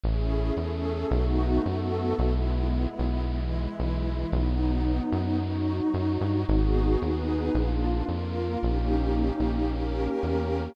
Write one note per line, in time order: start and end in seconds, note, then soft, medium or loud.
0.03 0.52 A1 loud
0.03 0.56 A3 medium
0.03 0.56 C#4 medium
0.03 0.57 E4 medium
0.03 0.56 G#4 medium
0.57 1.05 E2 medium
0.57 1.10 A3 medium
0.57 1.10 C#4 medium
0.57 1.10 G#4 medium
0.57 1.10 A4 medium
1.10 1.59 B1 loud
1.10 1.64 A3 medium
1.10 1.64 B3 medium
1.10 1.64 D#4 medium
1.10 1.64 F#4 medium
1.65 2.14 F#2 medium
1.65 2.18 A3 medium
1.65 2.17 B3 medium
1.65 2.18 F#4 medium
1.65 2.18 A4 medium
2.18 2.87 B1 loud
2.18 3.24 G#3 medium
2.18 3.24 B3 medium
2.18 3.24 E4 medium
2.99 3.68 B1 medium
3.25 4.31 E3 medium
3.25 4.31 G#3 medium
3.25 4.31 E4 medium
3.80 4.25 B1 medium
4.31 5.00 B1 loud
4.31 5.37 F#3 medium
4.31 5.37 B3 medium
4.31 5.37 D#4 medium
5.12 5.81 F#2 medium
5.40 6.46 F#3 medium
5.40 6.46 D#4 medium
5.40 6.46 F#4 medium
5.94 6.18 F#2 medium
6.21 6.45 G2 medium
6.48 6.97 G#1 loud
6.48 7.00 B3 medium
6.48 7.00 D#4 medium
6.48 7.01 F#4 medium
6.48 7.00 G#4 medium
7.00 7.50 D#2 medium
7.00 7.53 B3 medium
7.00 7.53 D#4 medium
7.00 7.53 G#4 medium
7.00 7.53 B4 medium
7.54 8.03 A#1 loud
7.54 8.06 A#3 medium
7.54 8.07 D4 medium
7.54 8.06 F4 medium
8.06 8.57 F2 medium
8.06 8.59 A#3 medium
8.06 8.59 F4 medium
8.06 8.59 A#4 medium
8.61 9.31 A#1 loud
8.61 9.67 A#3 medium
8.61 9.67 C#4 medium
8.61 9.67 D#4 medium
8.61 9.67 G4 medium
9.40 10.08 A#1 medium
9.68 10.74 A#3 medium
9.68 10.74 C#4 medium
9.68 10.74 G4 medium
9.68 10.74 A#4 medium
10.23 10.69 E2 medium